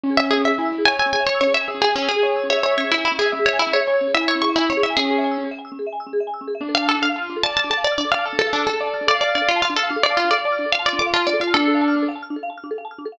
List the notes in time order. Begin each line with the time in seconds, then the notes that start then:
0.03 C#4
0.10 G#4
0.17 E5
0.24 G#5
0.30 G#4 E6
0.37 C#4
0.45 G#4 E5
0.52 E5
0.58 E4 G#5
0.65 E6
0.72 C#4
0.78 G#4
0.85 C#5 E5 G#5
0.93 G#5
0.99 G#5 E6
1.06 C#4
1.13 G#4 G#5
1.20 E5
1.26 C#5 G#5
1.34 E6
1.40 C#4 C#5
1.47 G#4
1.54 C#5 E5
1.61 G#5
1.68 G#4 E6
1.74 C#4
1.81 G#4
1.89 E5
1.96 C#4 G#5
2.02 E6
2.09 C#4 G#4
2.16 G#4
2.22 C#5 E5
2.29 G#5
2.36 E6
2.44 C#4
2.50 G#4 C#5 E5
2.57 E5
2.63 C#5 G#5
2.71 E6
2.77 C#4 C#5
2.84 G#4
2.91 E4 E5
2.98 G#5
3.05 E4 E6
3.11 C#4
3.18 G#4 E5
3.25 E5
3.32 C#4 E5
3.39 G#4
3.46 C#5 E5
3.53 G#5
3.59 E4 E6
3.67 C#4
3.73 G#4 C#5
3.80 E5
3.87 C#5 G#5
3.93 E6
4.01 C#4
4.07 G#4
4.14 E4 E5
4.21 G#5
4.28 C#5 E6
4.35 C#4
4.42 G#4 C#6
4.49 E5
4.56 E4 G#5
4.62 E6
4.70 C#4 C#5
4.77 G#4
4.83 E4 E5
4.90 G#5
4.97 C#4 G#4 E6
5.03 C#4
5.10 G#4
5.18 E5
5.24 G#5
5.31 E6
5.38 C#4
5.44 G#4
5.51 E5
5.59 G#5
5.65 E6
5.72 C#4
5.79 G#4
5.87 E5
5.93 G#5
6.00 E6
6.07 C#4
6.13 G#4
6.20 E5
6.27 G#5
6.34 E6
6.41 C#4
6.47 G#4
6.55 E5
6.61 D4
6.69 A4
6.75 F5
6.82 A5
6.88 A4 F6
6.95 D4
7.02 A4 F5
7.09 F5
7.16 F4 A5
7.22 F6
7.30 D4
7.36 A4
7.43 D5 F5 A5
7.50 A5
7.57 A5 F6
7.64 D4
7.70 A4 A5
7.77 F5
7.84 D5 A5
7.92 F6
7.98 D4 D5
8.05 A4
8.12 D5 F5
8.19 A5
8.25 A4 F6
8.33 D4
8.39 A4
8.47 F5
8.53 D4 A5
8.60 F6
8.67 D4 A4
8.74 A4
8.80 D5 F5
8.87 A5
8.94 F6
9.01 D4
9.07 A4 D5 F5
9.14 F5
9.21 D5 A5
9.28 F6
9.35 D4 D5
9.42 A4
9.49 F4 F5
9.56 A5
9.62 F4 F6
9.70 D4
9.76 A4 F5
9.83 F5
9.89 D4 F5
9.96 A4
10.03 D5 F5
10.10 A5
10.17 F4 F6
10.24 D4
10.31 A4 D5
10.38 F5
10.45 D5 A5
10.52 F6
10.59 D4
10.66 A4
10.72 F4 F5
10.79 A5
10.86 D5 F6
10.93 D4
10.99 A4 D6
11.06 F5
11.13 F4 A5
11.20 F6
11.27 D4 D5
11.33 A4
11.40 F4 F5
11.47 A5
11.54 D4 A4 F6
11.61 D4
11.67 A4
11.75 F5
11.81 A5
11.88 F6
11.96 D4
12.02 A4
12.08 F5
12.16 A5
12.22 F6
12.30 D4
12.36 A4
12.43 F5
12.50 A5
12.58 F6
12.64 D4
12.71 A4
12.78 F5
12.85 A5
12.91 F6
12.98 D4
13.05 A4
13.12 F5